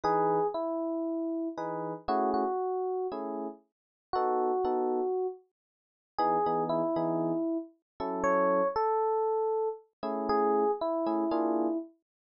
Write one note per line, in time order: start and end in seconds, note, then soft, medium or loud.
0.04 0.40 E3 medium
0.04 0.40 D#4 loud
0.04 0.47 G#4 loud
0.04 0.40 B4 loud
0.54 1.49 E4 medium
1.58 1.93 E3 medium
1.58 1.93 D#4 medium
1.58 1.93 G#4 medium
1.58 1.93 B4 medium
2.08 2.44 A3 loud
2.08 2.44 C#4 loud
2.08 2.44 E4 medium
2.08 2.30 F#4 medium
2.08 2.44 G#4 loud
2.34 3.07 F#4 medium
3.12 3.48 A3 medium
3.12 3.48 C#4 medium
3.12 3.48 E4 medium
3.12 3.48 G#4 medium
4.13 4.51 B3 medium
4.13 4.51 D#4 medium
4.13 5.27 F#4 medium
4.13 4.51 A4 loud
4.65 5.00 B3 loud
4.65 5.00 D#4 medium
4.65 5.00 F#4 medium
4.65 5.00 A4 medium
6.18 6.37 E3 loud
6.18 6.37 B3 loud
6.18 6.37 D#4 loud
6.18 6.64 G#4 loud
6.46 6.82 E3 medium
6.46 6.82 B3 medium
6.46 6.82 D#4 medium
6.46 6.82 G#4 medium
6.69 7.58 E4 medium
6.96 7.32 E3 loud
6.96 7.32 B3 medium
6.96 7.32 D#4 medium
6.96 7.32 G#4 medium
8.00 8.62 F#3 medium
8.00 8.62 C#4 loud
8.00 8.62 E4 medium
8.00 8.62 A4 loud
8.24 8.68 C#5 medium
8.76 9.69 A4 medium
10.03 10.64 A3 medium
10.03 10.64 C#4 medium
10.03 10.64 E4 loud
10.03 10.64 G#4 loud
10.29 10.71 G#4 loud
10.81 11.78 E4 medium
11.07 11.24 A3 medium
11.07 11.24 C#4 medium
11.07 11.24 E4 loud
11.07 11.24 G#4 medium
11.31 11.67 A#3 loud
11.31 11.67 D4 loud
11.31 11.67 F4 loud
11.31 11.67 G#4 loud